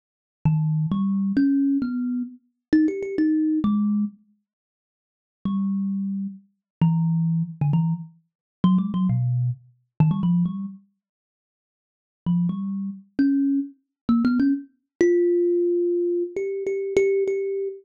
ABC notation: X:1
M:3/4
L:1/16
Q:1/4=132
K:none
V:1 name="Kalimba"
z4 ^D,4 G,4 | ^C4 B,4 z4 | (3^D2 G2 G2 D4 ^G,4 | z12 |
G,8 z4 | E,6 z D, E,2 z2 | z4 (3^F,2 ^G,2 F,2 B,,4 | z4 ^D, G, F,2 G,2 z2 |
z12 | F,2 G,4 z2 ^C4 | z4 (3^A,2 B,2 ^C2 z4 | F12 |
(3G4 G4 G4 G4 |]